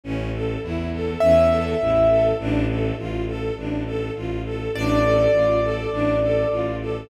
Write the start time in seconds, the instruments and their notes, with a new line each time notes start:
0.04 violin A1, string ensemble 1 C#4
0.34 string ensemble 1 A4
0.63 violin E2, string ensemble 1 E4
0.93 string ensemble 1 A4
1.20 violin E2, string ensemble 1 C#4, acoustic grand piano E5
1.51 string ensemble 1 A4
1.80 violin A1, string ensemble 1 E4
2.10 string ensemble 1 A4
2.39 violin A1, string ensemble 1 D4
2.69 string ensemble 1 A4
2.98 violin A1, string ensemble 1 F4
3.27 string ensemble 1 A4
3.57 violin A1, string ensemble 1 D4
3.86 string ensemble 1 A4
4.15 violin A1, string ensemble 1 F4
4.45 string ensemble 1 A4
4.74 violin A1, string ensemble 1 D4, acoustic grand piano D5
5.04 string ensemble 1 A4
5.33 violin A1, string ensemble 1 F4
5.63 string ensemble 1 A4
5.92 violin A1, string ensemble 1 D4
6.22 string ensemble 1 A4
6.50 violin A1, string ensemble 1 F4
6.81 string ensemble 1 A4